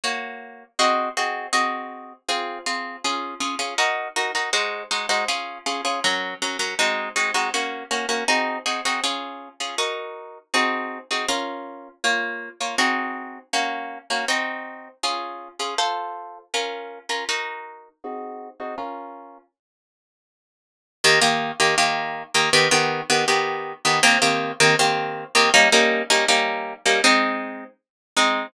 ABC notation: X:1
M:2/4
L:1/16
Q:1/4=80
K:Db
V:1 name="Orchestral Harp"
[B,Gd]4 [CGAe]2 [CGAe]2 | [CGAe]4 [CFA]2 [CFA]2 | [DFA]2 [DFA] [DFA] [EGB]2 [EGB] [EGB] | [A,EGc]2 [A,EGc] [A,EGc] [DFA]2 [DFA] [DFA] |
[G,DB]2 [G,DB] [G,DB] [A,CEG]2 [A,CEG] [A,CEG] | [B,DG]2 [B,DG] [B,DG] [CEGA]2 [CEGA] [CEGA] | [DFA]3 [DFA] [EGB]4 | [CEGA]3 [CEGA] [DFB]4 |
[B,Fd]3 [B,Fd] [CEGA]4 | [B,DG]3 [B,DG] [CEG]4 | [DFA]3 [DFA] [F=Ac]4 | [DFB]3 [DFB] [EGB]4 |
[CEGA]3 [CEGA] [DFB]4 | z8 | [K:Eb] [E,B,G] [E,B,G]2 [E,B,G] [E,B,G]3 [E,B,G] | [E,=B,G] [E,B,G]2 [E,B,G] [E,B,G]3 [E,B,G] |
[E,B,CG] [E,B,CG]2 [E,B,CG] [E,B,CG]3 [E,B,CG] | [G,B,_DE] [G,B,DE]2 [G,B,DE] [G,B,DE]3 [G,B,DE] | [A,CE]6 [A,CE]2 |]